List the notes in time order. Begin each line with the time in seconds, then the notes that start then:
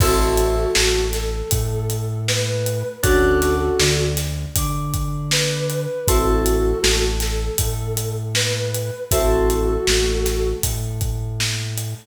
0.00 A1 C4 E4 F#4 A4, kick, crash
0.38 closed hi-hat
0.75 A1 A3, snare
1.13 A4, snare, closed hi-hat
1.51 A2 A3, kick, closed hi-hat
1.90 closed hi-hat
2.28 B4, snare
2.66 closed hi-hat
3.03 D2 C#4 D4 F#4 A4, kick, closed hi-hat
3.42 snare, closed hi-hat
3.79 D2 D3, snare
4.17 snare, closed hi-hat
4.56 D3 D4, kick, closed hi-hat
4.94 kick, closed hi-hat
5.31 B4, snare
5.70 closed hi-hat
6.08 A1 C4 E4 F#4 A4, kick, closed hi-hat
6.46 closed hi-hat
6.83 A1 A3, snare
7.20 A4, snare, closed hi-hat
7.58 A2 A3, kick, closed hi-hat
7.97 closed hi-hat
8.35 B4, snare
8.75 closed hi-hat
9.11 A1 C4 E4 F#4 A4, kick, closed hi-hat
9.50 closed hi-hat
9.87 A1 A3, snare
10.26 snare, closed hi-hat
10.63 A2 A3, kick, closed hi-hat
11.01 kick, closed hi-hat
11.40 snare
11.78 closed hi-hat